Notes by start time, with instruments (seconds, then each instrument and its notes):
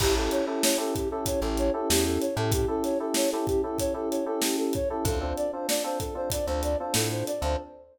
0.00 electric bass (finger) A1, electric piano 2 C#4 E4 G4 A4, ocarina G4, kick, crash
0.16 electric piano 2 C#4 E4 G4 A4, ocarina A4
0.31 ocarina C#5, closed hi-hat
0.47 electric piano 2 C#4 E4 G4 A4, ocarina A4
0.63 ocarina C#5, snare
0.78 electric piano 2 C#4 E4 G4 A4, ocarina A4
0.94 ocarina G4, kick, closed hi-hat
1.10 electric piano 2 C#4 E4 G4 A4, ocarina A4
1.26 ocarina C#5, kick, closed hi-hat
1.42 electric bass (finger) A1, electric piano 2 C#4 E4 G4 A4, ocarina A4
1.58 ocarina C#5, closed hi-hat
1.74 electric piano 2 C#4 E4 G4 A4, ocarina A4
1.90 electric bass (finger) E2, ocarina G4, snare
2.05 ocarina A4
2.21 ocarina C#5, closed hi-hat
2.36 electric bass (finger) A2, electric piano 2 C#4 E4 G4 A4, ocarina A4
2.52 ocarina G4, kick, closed hi-hat
2.68 electric piano 2 C#4 E4 G4 A4, ocarina A4
2.84 ocarina C#5, snare, closed hi-hat
3.00 electric piano 2 C#4 E4 G4 A4, ocarina A4
3.14 ocarina C#5, snare
3.31 electric piano 2 C#4 E4 G4 A4, ocarina A4
3.47 ocarina G4, kick, closed hi-hat
3.63 electric piano 2 C#4 E4 G4 A4, ocarina A4
3.78 ocarina C#5, kick, closed hi-hat
3.94 electric piano 2 C#4 E4 G4 A4, ocarina A4
4.11 ocarina C#5, closed hi-hat
4.26 electric piano 2 C#4 E4 G4 A4, ocarina A4
4.42 ocarina G4, snare
4.58 ocarina A4
4.73 ocarina C#5, kick, closed hi-hat
4.90 electric piano 2 C#4 E4 G4 A4, ocarina A4
5.05 electric bass (finger) D2, electric piano 2 C4 D4 F4 A4, ocarina A4, kick, closed hi-hat
5.21 electric piano 2 C4 D4 F4 A4, ocarina C5
5.37 ocarina D5, closed hi-hat
5.52 electric piano 2 C4 D4 F4 A4, ocarina C5
5.69 ocarina D5, snare
5.84 electric piano 2 C4 D4 F4 A4, ocarina C5
6.00 ocarina A4, kick, closed hi-hat
6.15 electric piano 2 C4 D4 F4 A4, ocarina C5
6.30 ocarina D5, kick, closed hi-hat
6.47 electric bass (finger) D2, electric piano 2 C4 D4 F4 A4, ocarina C5
6.63 ocarina D5, closed hi-hat
6.79 electric piano 2 C4 D4 F4 A4, ocarina C5
6.94 electric bass (finger) A2, ocarina A4, snare
7.11 ocarina C5
7.27 ocarina D5, closed hi-hat
7.41 electric bass (finger) D2, electric piano 2 C4 D4 F4 A4, ocarina C5